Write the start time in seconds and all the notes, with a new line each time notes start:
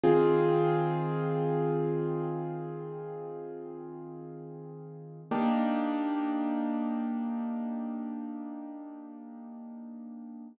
0.04 D#3 C4 F4 G#4
5.31 A#3 D4 D#4 G4